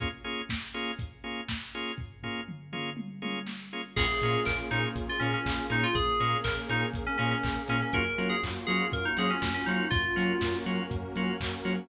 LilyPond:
<<
  \new Staff \with { instrumentName = "Electric Piano 2" } { \time 4/4 \key bes \minor \tempo 4 = 121 r1 | r1 | aes'4 bes'16 r16 ees'16 r8 f'16 des'16 des'8. ees'16 f'16 | aes'4 bes'16 r16 ees'16 r8 des'16 des'16 des'8. des'16 des'16 |
bes'8. aes'16 r8 aes'8 bes'16 ees'16 aes'16 des'8 des'16 ees'8 | f'4. r2 r8 | }
  \new Staff \with { instrumentName = "Drawbar Organ" } { \time 4/4 \key bes \minor <bes des' f' aes'>8 <bes des' f' aes'>4 <bes des' f' aes'>4 <bes des' f' aes'>4 <bes des' f' aes'>8~ | <bes des' f' aes'>8 <bes des' f' aes'>4 <bes des' f' aes'>4 <bes des' f' aes'>4 <bes des' f' aes'>8 | <bes des' f' aes'>8 <bes des' f' aes'>4 <bes des' f' aes'>4 <bes des' f' aes'>4 <bes des' f' aes'>8~ | <bes des' f' aes'>8 <bes des' f' aes'>4 <bes des' f' aes'>4 <bes des' f' aes'>4 <bes des' f' aes'>8 |
<bes des' f' ges'>8 <bes des' f' ges'>4 <bes des' f' ges'>4 <bes des' f' ges'>4 <bes des' f' ges'>8~ | <bes des' f' ges'>8 <bes des' f' ges'>4 <bes des' f' ges'>4 <bes des' f' ges'>4 <bes des' f' ges'>8 | }
  \new Staff \with { instrumentName = "Synth Bass 2" } { \clef bass \time 4/4 \key bes \minor r1 | r1 | bes,,8 bes,8 bes,,8 bes,8 bes,,8 bes,8 bes,,8 bes,8 | bes,,8 bes,8 bes,,8 bes,8 bes,,8 bes,8 bes,,8 bes,8 |
ges,8 ges8 ges,8 ges8 ges,8 ges8 ges,8 ges8 | ges,8 ges8 ges,8 ges8 ges,8 ges8 ges,8 ges8 | }
  \new Staff \with { instrumentName = "Pad 5 (bowed)" } { \time 4/4 \key bes \minor r1 | r1 | <bes des' f' aes'>1 | <bes des' aes' bes'>1 |
<bes des' f' ges'>1 | <bes des' ges' bes'>1 | }
  \new DrumStaff \with { instrumentName = "Drums" } \drummode { \time 4/4 <hh bd>4 <bd sn>4 <hh bd>4 <bd sn>4 | <bd tomfh>8 tomfh8 toml8 toml8 tommh8 tommh8 sn4 | <cymc bd>8 hho8 <hc bd>8 hho8 <hh bd>8 hho8 <hc bd>8 hho8 | <hh bd>8 hho8 <hc bd>8 hho8 <hh bd>8 hho8 <hc bd>8 hho8 |
<hh bd>8 hho8 <hc bd>8 hho8 <hh bd>8 hho8 <bd sn>8 hho8 | <hh bd>8 hho8 <bd sn>8 hho8 <hh bd>8 hho8 <hc bd>8 hho8 | }
>>